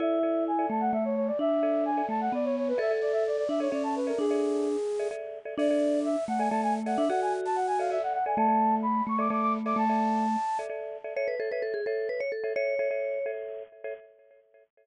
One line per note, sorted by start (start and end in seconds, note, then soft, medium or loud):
0.00 0.66 E4 medium
0.00 0.19 A4 medium
0.00 0.19 D5 medium
0.00 0.44 E5 medium
0.00 0.19 E5 medium
0.23 0.51 A4 medium
0.23 0.51 D5 medium
0.23 0.51 E5 medium
0.48 0.67 G#5 medium
0.59 0.96 A4 medium
0.59 0.96 D5 medium
0.59 0.96 E5 medium
0.70 0.91 A3 medium
0.70 0.81 A5 medium
0.81 0.92 F#5 medium
0.93 1.31 A3 medium
0.93 1.04 E5 medium
1.05 1.15 C#5 medium
1.16 1.27 C#5 medium
1.27 1.38 D5 medium
1.39 2.02 D4 medium
1.39 1.84 E5 medium
1.63 1.91 A4 medium
1.63 1.91 D5 medium
1.63 1.91 E5 medium
1.85 2.05 G#5 medium
1.97 2.34 A4 medium
1.97 2.34 D5 medium
1.97 2.34 E5 medium
2.09 2.29 A3 medium
2.09 2.20 A5 medium
2.21 2.32 F#5 medium
2.32 2.73 B3 medium
2.32 2.45 D5 medium
2.45 2.56 C#5 medium
2.57 2.68 C#5 medium
2.68 2.79 B4 medium
2.78 2.87 A4 medium
2.78 3.44 A4 medium
2.78 2.87 D5 medium
2.78 2.87 E5 medium
2.78 2.92 E5 medium
2.91 3.28 A4 medium
2.91 3.28 D5 medium
2.91 3.28 E5 medium
3.01 3.12 D5 medium
3.12 3.24 E5 medium
3.27 3.37 D5 medium
3.37 3.48 D5 medium
3.49 3.68 D4 medium
3.49 3.60 E5 medium
3.60 3.69 A4 medium
3.60 3.71 C#5 medium
3.60 3.69 D5 medium
3.60 3.69 E5 medium
3.72 4.12 C#4 medium
3.72 4.00 A4 medium
3.72 4.00 D5 medium
3.72 3.83 D5 medium
3.72 4.00 E5 medium
3.83 3.94 A5 medium
3.96 4.07 B4 medium
4.07 4.25 A4 medium
4.07 4.18 A#4 medium
4.07 4.25 D5 medium
4.07 4.25 E5 medium
4.19 4.76 D4 medium
4.19 5.08 G#4 medium
4.31 4.68 A4 medium
4.31 4.68 D5 medium
4.31 4.68 E5 medium
4.99 5.09 A4 medium
4.99 5.09 D5 medium
4.99 5.09 E5 medium
5.11 5.39 A4 medium
5.11 5.39 D5 medium
5.11 5.39 E5 medium
5.45 5.55 A4 medium
5.45 5.55 D5 medium
5.45 5.55 E5 medium
5.58 6.16 D4 medium
5.58 5.68 A4 medium
5.58 5.68 D5 medium
5.58 6.00 D5 medium
5.58 5.68 E5 medium
5.71 6.08 A4 medium
5.71 6.08 D5 medium
5.71 6.08 E5 medium
6.05 6.24 E5 medium
6.28 6.49 A3 medium
6.28 6.39 F#5 medium
6.38 6.49 A4 medium
6.38 6.49 D5 medium
6.38 6.49 E5 medium
6.38 6.49 G#5 medium
6.50 6.96 A3 medium
6.50 6.79 A4 medium
6.50 6.79 D5 medium
6.50 6.79 E5 medium
6.50 6.61 A5 medium
6.63 6.74 G#5 medium
6.86 7.05 A4 medium
6.86 7.05 D5 medium
6.86 7.05 E5 medium
6.86 6.97 F#5 medium
6.97 7.09 D4 medium
6.97 7.08 E5 medium
7.09 7.98 F#4 medium
7.09 7.47 A4 medium
7.09 7.47 D5 medium
7.09 7.47 E5 medium
7.09 7.21 F#5 medium
7.22 7.33 G#5 medium
7.45 7.56 A5 medium
7.56 7.67 F#5 medium
7.67 7.78 G#5 medium
7.79 7.88 A4 medium
7.79 7.88 D5 medium
7.79 7.88 E5 medium
7.79 7.90 F5 medium
7.90 8.18 A4 medium
7.90 8.18 D5 medium
7.90 8.18 E5 medium
7.90 8.02 E5 medium
8.03 8.13 F#5 medium
8.13 8.24 F#5 medium
8.26 8.35 A4 medium
8.26 8.35 D5 medium
8.26 8.35 E5 medium
8.26 8.37 G#5 medium
8.37 9.02 A3 medium
8.37 8.47 A4 medium
8.37 8.47 D5 medium
8.37 8.47 E5 medium
8.37 8.75 A5 medium
8.48 8.85 A4 medium
8.48 8.85 D5 medium
8.48 8.85 E5 medium
8.82 9.03 B5 medium
9.07 9.29 A3 medium
9.07 9.19 C#6 medium
9.18 9.28 A4 medium
9.18 9.28 D5 medium
9.18 9.28 E5 medium
9.18 9.30 D6 medium
9.30 9.74 A3 medium
9.30 9.58 A4 medium
9.30 9.58 D5 medium
9.30 9.58 E5 medium
9.30 9.41 D6 medium
9.42 9.53 D6 medium
9.66 9.84 A4 medium
9.66 9.84 D5 medium
9.66 9.84 E5 medium
9.66 9.77 D6 medium
9.76 10.36 A3 medium
9.76 10.58 A5 medium
9.89 10.26 A4 medium
9.89 10.26 D5 medium
9.89 10.26 E5 medium
10.59 10.68 A4 medium
10.59 10.68 D5 medium
10.59 10.68 E5 medium
10.69 10.97 A4 medium
10.69 10.97 D5 medium
10.69 10.97 E5 medium
11.04 11.14 A4 medium
11.04 11.14 D5 medium
11.04 11.14 E5 medium
11.16 11.35 A4 medium
11.16 11.35 C#5 medium
11.16 11.28 C#5 medium
11.16 11.35 E5 medium
11.28 11.39 B4 medium
11.39 11.49 A4 medium
11.39 11.51 A4 medium
11.39 11.49 C#5 medium
11.39 11.49 E5 medium
11.51 11.80 A4 medium
11.51 11.62 B4 medium
11.51 11.80 C#5 medium
11.51 11.80 E5 medium
11.62 11.73 A4 medium
11.74 11.85 G#4 medium
11.86 12.08 A4 medium
11.86 12.24 A4 medium
11.86 12.24 C#5 medium
11.86 12.24 E5 medium
12.09 12.20 B4 medium
12.20 12.31 C#5 medium
12.32 12.53 A4 medium
12.44 12.53 A4 medium
12.44 12.53 C#5 medium
12.44 12.53 E5 medium
12.56 12.74 A4 medium
12.56 12.74 C#5 medium
12.56 13.31 C#5 medium
12.56 12.74 E5 medium
12.79 12.88 A4 medium
12.79 12.88 C#5 medium
12.79 12.88 E5 medium
12.91 13.19 A4 medium
12.91 13.19 C#5 medium
12.91 13.19 E5 medium
13.26 13.63 A4 medium
13.26 13.63 C#5 medium
13.26 13.63 E5 medium
13.84 13.94 A4 medium
13.84 13.94 C#5 medium
13.84 13.94 E5 medium